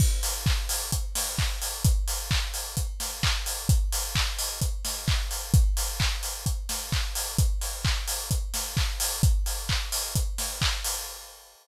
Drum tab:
CC |x-------|--------|--------|--------|
HH |-o-oxo-o|xo-oxo-o|xo-oxo-o|xo-oxo-o|
CP |--x---x-|--x---x-|--x---x-|--x---x-|
SD |-----o--|-----o--|-----o--|-----o--|
BD |o-o-o-o-|o-o-o-o-|o-o-o-o-|o-o-o-o-|

CC |--------|--------|
HH |xo-oxo-o|xo-oxo-o|
CP |--x---x-|--x---x-|
SD |-----o--|-----o--|
BD |o-o-o-o-|o-o-o-o-|